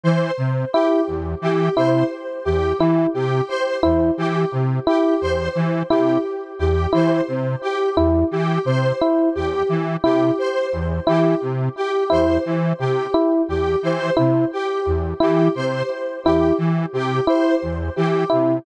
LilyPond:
<<
  \new Staff \with { instrumentName = "Lead 1 (square)" } { \clef bass \time 6/8 \tempo 4. = 58 e8 c8 r8 e,8 e8 c8 | r8 e,8 e8 c8 r8 e,8 | e8 c8 r8 e,8 e8 c8 | r8 e,8 e8 c8 r8 e,8 |
e8 c8 r8 e,8 e8 c8 | r8 e,8 e8 c8 r8 e,8 | e8 c8 r8 e,8 e8 c8 | r8 e,8 e8 c8 r8 e,8 |
e8 c8 r8 e,8 e8 c8 | }
  \new Staff \with { instrumentName = "Electric Piano 1" } { \time 6/8 r4 e'8 r4 e'8 | r4 e'8 r4 e'8 | r4 e'8 r4 e'8 | r4 e'8 r4 e'8 |
r4 e'8 r4 e'8 | r4 e'8 r4 e'8 | r4 e'8 r4 e'8 | r4 e'8 r4 e'8 |
r4 e'8 r4 e'8 | }
  \new Staff \with { instrumentName = "Lead 1 (square)" } { \time 6/8 c''8 r8 g'8 r8 g'8 c''8 | r8 g'8 r8 g'8 c''8 r8 | g'8 r8 g'8 c''8 r8 g'8 | r8 g'8 c''8 r8 g'8 r8 |
g'8 c''8 r8 g'8 r8 g'8 | c''8 r8 g'8 r8 g'8 c''8 | r8 g'8 r8 g'8 c''8 r8 | g'8 r8 g'8 c''8 r8 g'8 |
r8 g'8 c''8 r8 g'8 r8 | }
>>